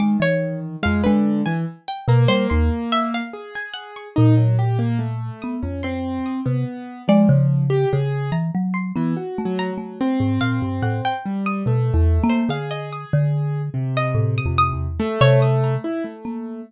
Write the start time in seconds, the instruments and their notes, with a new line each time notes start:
0.00 acoustic grand piano D#3, marimba G#3, pizzicato strings D6
0.20 marimba E3, pizzicato strings C#5
0.83 marimba F2, acoustic grand piano G#3, pizzicato strings F5
1.04 acoustic grand piano D3, marimba G#3, pizzicato strings B4
1.46 acoustic grand piano E3, pizzicato strings G#5
1.88 pizzicato strings G5
2.08 marimba B2, acoustic grand piano A#3, pizzicato strings A#5
2.28 marimba G3, pizzicato strings C5
2.50 marimba D#2, pizzicato strings C6
2.92 pizzicato strings E5
3.14 pizzicato strings F5
3.33 acoustic grand piano G#4
3.55 pizzicato strings G#5
3.74 pizzicato strings F#5
3.96 pizzicato strings C#6
4.16 marimba A#2, acoustic grand piano D#4
4.37 acoustic grand piano F#3
4.59 acoustic grand piano G4
4.79 acoustic grand piano A#3
4.99 acoustic grand piano A3
5.42 marimba B3, pizzicato strings D#6
5.62 marimba F2, acoustic grand piano C#4
5.83 acoustic grand piano C4, pizzicato strings C6
6.26 pizzicato strings D#6
6.45 marimba C3, acoustic grand piano B3
7.08 acoustic grand piano F3, marimba G#3, pizzicato strings D5
7.29 marimba C#3
7.70 acoustic grand piano G4
7.93 marimba C#3, acoustic grand piano G#4
8.32 marimba E3, pizzicato strings A#5
8.55 marimba F#3
8.74 pizzicato strings C6
8.96 acoustic grand piano E3, marimba B3
9.17 acoustic grand piano F#4
9.38 marimba A3
9.45 acoustic grand piano F#3
9.59 pizzicato strings A#5
9.73 acoustic grand piano F#3
9.78 marimba A3
10.01 acoustic grand piano C4
10.20 marimba G#2
10.41 marimba A#2, pizzicato strings F5
10.62 marimba G2
10.82 marimba A2, pizzicato strings F#5
11.05 pizzicato strings G5
11.26 acoustic grand piano G3
11.46 pizzicato strings D#6
11.66 marimba B2, acoustic grand piano A3
11.94 marimba E2
12.24 marimba A#3
12.30 pizzicato strings C5
12.49 marimba D3, acoustic grand piano G#4, pizzicato strings F5
12.71 pizzicato strings D#5
12.93 pizzicato strings D#6
13.13 marimba D3
13.74 acoustic grand piano C3
13.97 pizzicato strings D#5
14.15 marimba A2
14.38 pizzicato strings D#6
14.46 marimba F2
14.58 pizzicato strings D#6
14.73 marimba E2
14.99 acoustic grand piano A3, marimba A3
15.21 marimba C3, pizzicato strings C#5
15.42 pizzicato strings D#6
15.64 pizzicato strings A#5
15.84 acoustic grand piano E4
16.04 acoustic grand piano A3
16.25 marimba A#3